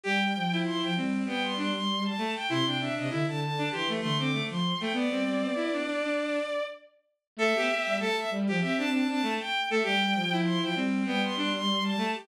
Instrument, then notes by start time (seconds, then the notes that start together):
violin
0.03 G3 G4 G5
0.35 F3
0.52 E4
0.65 C6
0.81 F3 G5
0.96 G3 C4
1.24 G3 B3 G5
1.43 C6
1.56 D4 C6
1.74 C6
2.04 A5
2.18 A3
2.34 G5
2.49 C3 E4 C6
2.64 C3 D4 G5
2.79 D4 E5
2.97 C3 D#5
3.09 D3 E4 E5
3.26 D3 A5
3.40 A5
3.57 D4
3.71 E3 G4 C6
3.88 A3
4.01 D3 A3 C6
4.18 C4 D6
4.32 A3
4.49 F3 C6
4.80 A3 G5
4.93 B3 D5
5.10 G3 C4
5.41 B3
5.55 E4
5.72 D4
5.85 D4
6.02 D4
7.36 A3 A4 E5
7.55 B3 G4
7.69 G4
7.86 G3
7.99 A3 A4 A5
8.17 E5
8.30 G3
8.47 F3 G4
8.60 C4 G4 E5
8.77 D4 A5
8.91 D4 A5
9.08 C4 D4 A5
9.22 A3
9.39 G5
9.70 A3 A4 E5
9.83 G3 G4 G5
10.14 F3
10.31 E4
10.45 C6
10.62 F3 G5
10.75 G3 C4
11.05 G3 B3 G5
11.23 C6
11.36 D4 C6
11.54 C6
11.83 A5
11.97 A3
12.14 G4